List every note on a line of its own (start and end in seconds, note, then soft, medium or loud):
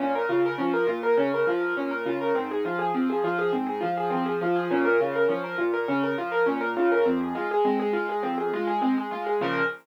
0.00 0.26 A#2 loud
0.00 0.13 C#4 medium
0.15 0.29 A#4 medium
0.29 0.56 C#3 medium
0.29 0.43 F4 medium
0.46 0.59 A#4 medium
0.58 0.86 F3 medium
0.58 0.72 C#4 medium
0.74 0.87 A#4 medium
0.87 1.14 A#2 medium
0.87 1.00 F4 medium
1.03 1.17 A#4 medium
1.17 1.44 C#3 loud
1.17 1.31 C#4 medium
1.34 1.48 A#4 medium
1.47 1.74 F3 medium
1.47 1.62 F4 medium
1.60 1.74 A#4 medium
1.77 2.03 A#2 medium
1.77 1.90 C#4 medium
1.91 2.05 A#4 medium
2.06 2.32 C#3 medium
2.06 2.20 F4 medium
2.21 2.34 A#4 medium
2.35 2.62 G#2 loud
2.35 2.48 C4 medium
2.51 2.65 G#4 medium
2.65 2.91 F3 medium
2.65 2.79 F4 medium
2.79 2.92 G#4 medium
2.94 3.21 F3 medium
2.94 3.08 C4 medium
3.10 3.23 G#4 medium
3.24 3.50 F3 medium
3.24 3.38 F4 medium
3.38 3.52 G#4 medium
3.53 3.79 G#2 loud
3.53 3.66 C4 medium
3.67 3.80 G#4 medium
3.81 4.09 F3 medium
3.81 3.94 F4 medium
3.97 4.11 G#4 medium
4.10 4.39 F3 medium
4.10 4.24 C4 medium
4.26 4.39 G#4 medium
4.41 4.68 F3 medium
4.41 4.56 F4 medium
4.56 4.69 G#4 medium
4.71 4.97 A#2 loud
4.71 4.84 C#4 medium
4.85 4.99 A#4 medium
5.00 5.26 C#3 medium
5.00 5.14 F4 medium
5.15 5.29 A#4 medium
5.28 5.56 F3 medium
5.28 5.42 C#4 medium
5.44 5.57 A#4 medium
5.58 5.86 A#2 medium
5.58 5.72 F4 medium
5.74 5.87 A#4 medium
5.88 6.15 C#3 medium
5.88 6.02 C#4 medium
6.03 6.17 A#4 medium
6.17 6.44 F3 medium
6.17 6.32 F4 medium
6.32 6.45 A#4 medium
6.46 6.73 A#2 medium
6.46 6.60 C#4 medium
6.61 6.74 A#4 medium
6.76 7.03 C#3 medium
6.76 6.90 F4 medium
6.92 7.05 A#4 medium
7.05 7.32 F2 loud
7.05 7.19 C4 medium
7.21 7.34 G#4 medium
7.35 7.62 G#3 medium
7.35 7.49 F4 medium
7.51 7.65 G#4 medium
7.65 7.91 G#3 loud
7.65 7.79 C4 medium
7.80 7.93 G#4 medium
7.93 8.20 G#3 medium
7.93 8.07 F4 medium
8.09 8.23 G#4 medium
8.23 8.50 F2 loud
8.23 8.36 C4 medium
8.38 8.51 G#4 medium
8.53 8.80 G#3 loud
8.53 8.67 F4 medium
8.67 8.81 G#4 medium
8.81 9.09 G#3 medium
8.81 8.95 C4 medium
8.98 9.11 G#4 medium
9.11 9.38 G#3 medium
9.11 9.25 F4 medium
9.26 9.40 G#4 medium
9.41 9.62 A#2 loud
9.41 9.62 C#3 loud
9.41 9.62 F3 loud
9.41 9.63 A#4 loud